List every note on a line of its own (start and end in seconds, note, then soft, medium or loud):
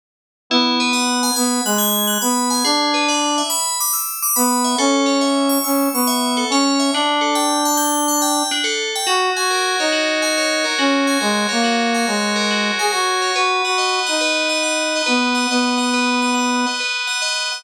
0.50 1.31 B3 loud
0.50 0.77 E4 loud
0.80 0.92 B4 medium
0.93 1.19 F#5 medium
1.23 1.35 G#5 medium
1.36 1.61 B3 loud
1.36 1.62 B5 medium
1.65 2.18 G#3 medium
1.65 1.78 F#6 medium
1.78 2.05 G#6 medium
2.07 2.19 F#6 medium
2.21 2.63 B3 medium
2.21 2.48 B5 medium
2.50 2.62 G#5 medium
2.64 3.42 D4 loud
2.64 2.91 G#4 medium
2.94 3.06 B4 medium
3.08 3.35 D5 medium
3.38 3.50 E5 medium
3.50 3.76 B5 medium
3.80 3.93 D6 medium
3.93 4.19 E6 medium
4.22 4.35 D6 loud
4.36 4.75 B3 loud
4.36 4.62 B5 medium
4.64 4.77 E5 medium
4.78 5.58 C#4 loud
4.78 5.05 A4 loud
5.06 5.18 C#5 medium
5.21 5.47 E5 medium
5.49 5.62 C#6 medium
5.64 5.88 C#4 medium
5.64 5.90 E6 medium
5.93 6.44 B3 medium
5.93 6.07 C#6 medium
6.07 6.34 E5 medium
6.37 6.49 A4 medium
6.50 6.91 C#4 loud
6.50 6.78 C#5 loud
6.79 6.92 E5 medium
6.93 8.43 D4 loud
6.93 7.21 D4 loud
7.21 7.33 A4 medium
7.35 7.62 G5 medium
7.65 7.77 A5 medium
7.77 8.04 G6 medium
8.08 8.20 A5 medium
8.22 8.48 G5 loud
8.51 8.63 D4 medium
8.64 8.90 A4 medium
8.95 9.08 G5 medium
9.06 9.30 F#4 loud
9.06 9.92 F#4 medium
9.36 9.76 F#4 medium
9.36 10.22 G#5 medium
9.51 10.64 A#4 medium
9.79 10.65 D#4 medium
9.79 10.37 C#5 medium
9.92 10.78 F#4 medium
10.22 11.07 G#5 medium
10.38 11.48 C#5 medium
10.64 11.20 A#4 medium
10.78 11.17 C#4 medium
10.78 11.63 F#4 medium
11.07 11.94 G#5 medium
11.21 11.47 G#3 loud
11.21 12.35 A#4 medium
11.49 12.06 A#3 medium
11.49 12.07 C#5 medium
11.63 12.50 F#4 medium
11.94 12.78 G#5 medium
12.07 12.71 G#3 medium
12.07 13.21 C#5 medium
12.36 12.92 A#4 medium
12.51 13.33 F#4 medium
12.79 12.92 G#4 medium
12.79 13.33 G#5 medium
12.92 13.32 F#4 medium
12.92 13.34 A#4 medium
13.22 13.35 C#5 medium
13.35 13.62 F#4 loud
13.35 14.20 B4 medium
13.65 14.00 F#4 medium
13.65 14.06 F#5 medium
13.78 14.95 D#5 medium
14.06 15.02 D#4 medium
14.06 14.48 F#5 medium
14.21 15.06 B4 medium
14.49 14.63 F#5 medium
14.63 15.34 F#5 medium
14.95 15.50 D#5 medium
15.06 15.47 B3 medium
15.06 15.93 B4 medium
15.35 15.77 F#5 medium
15.50 16.66 B3 loud
15.50 16.66 D#5 medium
15.78 16.21 F#5 medium
15.93 16.79 B4 medium
16.22 16.34 F#5 medium
16.34 17.07 F#5 medium
16.67 17.21 D#5 medium
16.80 17.63 B4 medium
17.07 17.51 F#5 medium
17.22 17.63 D#5 medium
17.52 17.64 F#5 medium